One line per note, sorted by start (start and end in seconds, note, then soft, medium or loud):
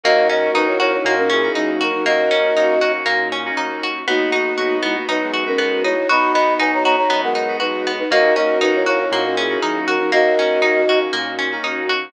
0.04 0.50 D#2 loud
0.04 0.24 A#3 medium
0.04 4.03 A#3 medium
0.04 0.28 A#3 medium
0.04 0.24 C#4 medium
0.04 4.03 C#4 medium
0.04 0.24 D#4 loud
0.04 4.03 D#4 medium
0.04 0.96 F#4 medium
0.04 0.24 F#4 medium
0.04 4.03 F#4 medium
0.04 0.28 F#4 loud
0.04 0.96 A#4 loud
0.04 0.28 D#5 loud
0.29 0.49 A#3 medium
0.29 0.49 C#4 medium
0.29 0.52 C#4 medium
0.29 0.49 D#4 medium
0.29 0.49 F#4 medium
0.29 0.51 F#4 medium
0.29 0.51 D#5 medium
0.54 0.99 D#2 medium
0.54 0.75 A#3 medium
0.54 0.75 C#4 medium
0.54 0.75 D#4 medium
0.54 0.78 D#4 medium
0.54 0.67 D#4 medium
0.54 0.75 F#4 medium
0.54 0.67 B4 medium
0.67 0.79 E4 medium
0.67 0.79 C#5 medium
0.80 1.20 A#3 medium
0.80 1.20 C#4 medium
0.80 1.20 D#4 medium
0.80 0.92 E4 medium
0.80 1.02 F#4 medium
0.80 1.20 F#4 medium
0.80 0.92 C#5 medium
0.93 1.15 E4 medium
0.93 1.15 C#5 medium
1.05 1.50 A#2 medium
1.05 1.29 A#3 medium
1.05 1.30 D#4 medium
1.05 1.30 F#4 medium
1.18 1.52 C#4 medium
1.18 1.52 A#4 medium
1.30 1.52 C#4 medium
1.30 1.72 E4 medium
1.30 1.72 G#4 medium
1.43 1.83 A#3 medium
1.43 1.83 C#4 medium
1.43 1.83 D#4 medium
1.43 1.83 F#4 medium
1.55 2.01 D#2 medium
1.55 1.91 F#3 medium
1.55 1.78 D#4 medium
1.55 1.91 D#4 medium
1.81 2.03 F#4 medium
1.81 2.05 F#4 medium
1.81 2.05 A#4 medium
1.93 2.05 F#3 medium
1.93 2.05 D#4 medium
2.05 2.51 D#2 medium
2.05 2.29 A#3 medium
2.05 2.92 F#4 medium
2.05 2.74 F#4 medium
2.05 2.74 A#4 loud
2.05 2.92 D#5 loud
2.31 2.51 A#3 medium
2.31 2.54 C#4 medium
2.31 2.51 C#4 medium
2.31 2.51 D#4 medium
2.31 2.51 F#4 medium
2.56 3.01 D#2 medium
2.56 2.76 A#3 medium
2.56 2.76 C#4 medium
2.56 2.76 D#4 medium
2.56 2.79 D#4 medium
2.56 2.76 F#4 medium
2.80 3.21 A#3 medium
2.80 3.21 C#4 medium
2.80 3.21 D#4 medium
2.80 3.21 F#4 medium
2.80 3.04 F#4 medium
3.06 3.51 A#2 medium
3.06 3.28 A#3 medium
3.32 3.55 C#4 medium
3.45 3.86 A#3 medium
3.45 3.86 C#4 medium
3.45 3.86 D#4 medium
3.45 3.86 F#4 medium
3.57 4.03 D#2 medium
3.57 3.80 D#4 medium
3.83 4.06 F#4 medium
4.07 4.53 B1 medium
4.07 4.77 A#3 medium
4.07 8.06 B3 medium
4.07 4.27 B3 medium
4.07 4.96 B3 medium
4.07 4.30 B3 medium
4.07 8.06 D#4 medium
4.07 4.27 D#4 medium
4.07 4.96 D#4 medium
4.07 8.06 F#4 medium
4.07 4.27 F#4 medium
4.07 4.77 F#4 loud
4.32 4.53 B3 medium
4.32 4.55 D#4 medium
4.32 4.53 D#4 medium
4.32 4.53 F#4 medium
4.58 5.03 B1 medium
4.58 4.79 B3 medium
4.58 4.79 D#4 medium
4.58 4.80 F#4 medium
4.58 4.79 F#4 medium
4.83 4.95 G#3 medium
4.83 5.05 B3 medium
4.83 5.24 B3 medium
4.83 5.24 D#4 medium
4.83 4.95 E4 medium
4.83 5.24 F#4 medium
4.96 5.08 A#3 medium
4.96 5.08 F#4 medium
5.08 5.54 F#2 medium
5.08 5.20 B3 medium
5.08 5.20 D#4 medium
5.08 5.31 D#4 medium
5.08 5.44 D#4 medium
5.08 5.44 B4 medium
5.21 5.95 G#3 medium
5.21 5.95 B3 medium
5.34 5.56 F#4 medium
5.46 5.86 B3 medium
5.46 5.82 C#4 medium
5.46 5.86 D#4 medium
5.46 5.86 F#4 medium
5.46 5.82 A#4 loud
5.58 6.05 B1 medium
5.58 5.81 B3 medium
5.84 6.07 D#4 medium
5.84 6.08 E4 medium
5.84 6.08 C#5 loud
6.09 6.54 B1 medium
6.09 6.96 B3 loud
6.09 6.96 D#4 loud
6.09 6.32 F#4 medium
6.09 6.32 D#5 medium
6.09 6.32 B5 medium
6.33 6.54 B3 medium
6.33 6.58 B3 medium
6.33 6.54 D#4 medium
6.33 6.54 F#4 medium
6.33 6.54 D#5 medium
6.33 6.54 B5 medium
6.59 7.05 B1 medium
6.59 6.80 B3 medium
6.59 6.80 D#4 medium
6.59 6.82 D#4 medium
6.59 6.80 F#4 medium
6.59 6.71 B4 medium
6.59 6.71 G#5 medium
6.74 6.84 C#5 medium
6.74 6.84 A#5 medium
6.84 7.25 B3 medium
6.84 7.25 D#4 medium
6.84 7.25 F#4 medium
6.84 7.08 F#4 medium
6.84 6.96 C#5 medium
6.84 6.96 A#5 loud
6.97 7.21 C#5 medium
6.97 7.21 A#5 medium
7.10 7.55 F#2 medium
7.10 7.21 B3 medium
7.10 7.33 B3 medium
7.10 7.22 D#4 medium
7.22 8.03 G#3 medium
7.22 8.03 B3 medium
7.22 7.57 A#4 medium
7.22 7.57 F#5 medium
7.35 7.58 D#4 medium
7.48 7.88 B3 medium
7.48 7.88 D#4 medium
7.48 7.88 F#4 medium
7.60 8.06 B1 medium
7.60 7.92 D#4 medium
7.60 7.83 F#4 medium
7.60 7.92 B4 medium
7.87 8.10 B3 medium
7.99 8.11 D#4 medium
7.99 8.11 B4 loud
8.10 8.56 D#2 loud
8.10 8.30 A#3 medium
8.10 12.10 A#3 medium
8.10 8.34 A#3 medium
8.10 8.30 C#4 medium
8.10 12.10 C#4 medium
8.10 8.30 D#4 loud
8.10 12.10 D#4 medium
8.10 8.30 F#4 medium
8.10 8.34 F#4 loud
8.10 12.10 F#4 medium
8.10 9.04 F#4 medium
8.10 9.04 A#4 loud
8.10 8.34 D#5 loud
8.36 8.57 A#3 medium
8.36 8.59 C#4 medium
8.36 8.57 C#4 medium
8.36 8.57 D#4 medium
8.36 8.58 F#4 medium
8.36 8.57 F#4 medium
8.36 8.58 D#5 medium
8.61 9.07 D#2 medium
8.61 8.83 A#3 medium
8.61 8.83 C#4 medium
8.61 8.84 D#4 medium
8.61 8.74 D#4 medium
8.61 8.83 D#4 medium
8.61 8.83 F#4 medium
8.61 8.74 B4 medium
8.75 8.86 E4 medium
8.75 8.86 C#5 medium
8.86 9.27 A#3 medium
8.86 9.27 C#4 medium
8.86 9.27 D#4 medium
8.86 8.99 E4 medium
8.86 9.09 F#4 medium
8.86 9.27 F#4 medium
8.86 8.99 C#5 medium
9.00 9.22 E4 medium
9.00 9.22 C#5 medium
9.11 9.57 A#2 medium
9.11 9.35 A#3 medium
9.11 9.36 D#4 medium
9.11 9.36 F#4 medium
9.25 9.58 C#4 medium
9.25 9.58 A#4 medium
9.37 9.60 C#4 medium
9.37 9.79 E4 medium
9.37 9.79 G#4 medium
9.49 9.90 A#3 medium
9.49 9.90 C#4 medium
9.49 9.90 D#4 medium
9.49 9.90 F#4 medium
9.62 10.07 D#2 medium
9.62 9.98 F#3 medium
9.62 9.98 D#4 medium
9.62 9.85 D#4 medium
9.87 10.11 F#4 medium
9.87 10.10 F#4 medium
9.87 10.11 A#4 medium
9.99 10.11 F#3 medium
9.99 10.11 D#4 medium
10.12 10.58 D#2 medium
10.12 10.35 A#3 medium
10.12 10.99 F#4 medium
10.12 10.82 F#4 medium
10.12 10.82 A#4 loud
10.12 10.99 D#5 loud
10.38 10.58 A#3 medium
10.38 10.58 C#4 medium
10.38 10.62 C#4 medium
10.38 10.58 D#4 medium
10.38 10.58 F#4 medium
10.62 11.08 D#2 medium
10.62 10.83 A#3 medium
10.62 10.83 C#4 medium
10.62 10.85 D#4 medium
10.62 10.83 D#4 medium
10.62 10.83 F#4 medium
10.88 11.29 A#3 medium
10.88 11.29 C#4 medium
10.88 11.29 D#4 medium
10.88 11.29 F#4 medium
10.88 11.12 F#4 medium
11.13 11.59 A#2 medium
11.13 11.36 A#3 medium
11.39 11.61 C#4 medium
11.52 11.92 A#3 medium
11.52 11.92 C#4 medium
11.52 11.92 D#4 medium
11.52 11.92 F#4 medium
11.63 12.09 D#2 medium
11.63 11.87 D#4 medium
11.89 12.12 F#4 medium